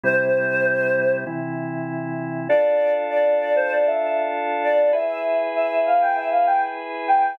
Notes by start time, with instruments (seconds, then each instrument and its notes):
0.03 drawbar organ C3 G3 E4, choir aahs C5
1.27 drawbar organ C3 E3 E4
2.49 drawbar organ D4 F4 A4, choir aahs D5
3.10 choir aahs D5
3.41 choir aahs D5
3.56 choir aahs C5
3.71 choir aahs D5
3.86 choir aahs E5
4.02 choir aahs E5
4.63 choir aahs D5
4.93 drawbar organ E4 G#4 B4, choir aahs E5
5.55 choir aahs E5
5.86 choir aahs F5
6.01 choir aahs G5
6.16 choir aahs E5
6.31 choir aahs F5
6.47 choir aahs G5
7.08 choir aahs G5